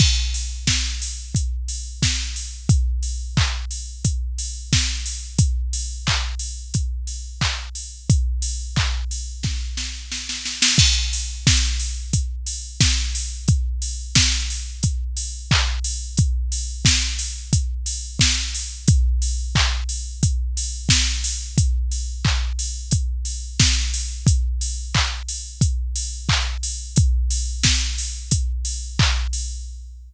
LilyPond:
\new DrumStaff \drummode { \time 4/4 \tempo 4 = 89 <cymc bd>8 hho8 <bd sn>8 hho8 <hh bd>8 hho8 <bd sn>8 hho8 | <hh bd>8 hho8 <hc bd>8 hho8 <hh bd>8 hho8 <bd sn>8 hho8 | <hh bd>8 hho8 <hc bd>8 hho8 <hh bd>8 hho8 <hc bd>8 hho8 | <hh bd>8 hho8 <hc bd>8 hho8 <bd sn>8 sn8 sn16 sn16 sn16 sn16 |
<cymc bd>8 hho8 <bd sn>8 hho8 <hh bd>8 hho8 <bd sn>8 hho8 | <hh bd>8 hho8 <bd sn>8 hho8 <hh bd>8 hho8 <hc bd>8 hho8 | <hh bd>8 hho8 <bd sn>8 hho8 <hh bd>8 hho8 <bd sn>8 hho8 | <hh bd>8 hho8 <hc bd>8 hho8 <hh bd>8 hho8 <bd sn>8 hho8 |
<hh bd>8 hho8 <hc bd>8 hho8 <hh bd>8 hho8 <bd sn>8 hho8 | <hh bd>8 hho8 <hc bd>8 hho8 <hh bd>8 hho8 <hc bd>8 hho8 | <hh bd>8 hho8 <bd sn>8 hho8 <hh bd>8 hho8 <hc bd>8 hho8 | }